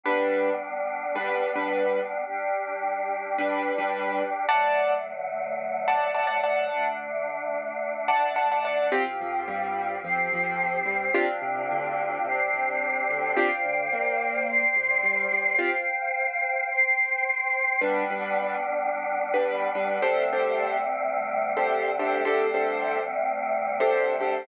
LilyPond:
<<
  \new Staff \with { instrumentName = "Acoustic Grand Piano" } { \time 4/4 \key g \major \tempo 4 = 108 <g d' b'>2 <g d' b'>8. <g d' b'>4~ <g d' b'>16~ | <g d' b'>2 <g d' b'>8. <g d' b'>4~ <g d' b'>16 | <d'' fis'' a''>2~ <d'' fis'' a''>8 <d'' fis'' a''>8 <d'' fis'' a''>16 <d'' fis'' a''>16 <d'' fis'' a''>8~ | <d'' fis'' a''>2~ <d'' fis'' a''>8 <d'' fis'' a''>8 <d'' fis'' a''>16 <d'' fis'' a''>16 <d'' fis'' a''>8 |
\key c \major <c' f' g'>8 f8 g4 f8 f4 g8 | <c' d' f' g'>8 c8 d4 c8 c4 d8 | <c' d' f' g'>8 d8 ais4. c8 g8 g8 | <c' f' g'>8 r2. r8 |
\key g \major <g d' b'>8 <g d' b'>2~ <g d' b'>16 <g d' b'>8. <g d' b'>8 | <d' g' a' c''>8 <d' g' a' c''>2~ <d' g' a' c''>16 <d' g' a' c''>8. <d' g' a' c''>8 | <d' g' a' c''>8 <d' g' a' c''>2~ <d' g' a' c''>16 <d' g' a' c''>8. <d' g' a' c''>8 | }
  \new Staff \with { instrumentName = "Synth Bass 2" } { \clef bass \time 4/4 \key g \major r1 | r1 | r1 | r1 |
\key c \major c,8 f,8 g,4 f,8 f,4 g,8 | g,,8 c,8 d,4 c,8 c,4 d,8 | g,,8 d,8 ais,,4. c,8 g,,8 g,,8 | r1 |
\key g \major r1 | r1 | r1 | }
  \new Staff \with { instrumentName = "Choir Aahs" } { \time 4/4 \key g \major <g b d'>1 | <g d' g'>1 | <d fis a>1 | <d a d'>1 |
\key c \major <c' f' g'>2 <c' g' c''>2 | <c' d' f' g'>2 <c' d' g' c''>2 | <c'' d'' f'' g''>2 <c'' d'' g'' c'''>2 | <c'' f'' g''>2 <c'' g'' c'''>2 |
\key g \major <g b d'>1 | <d g a c'>1 | <d g a c'>1 | }
>>